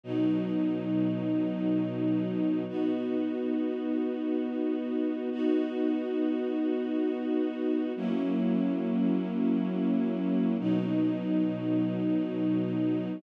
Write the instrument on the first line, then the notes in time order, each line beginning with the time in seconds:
string ensemble 1
0.04 B2 F#3 D#4
2.68 B3 D#4 F#4
5.32 B3 D#4 F#4
7.96 F#3 A#3 C#4 E4
10.59 B2 F#3 D#4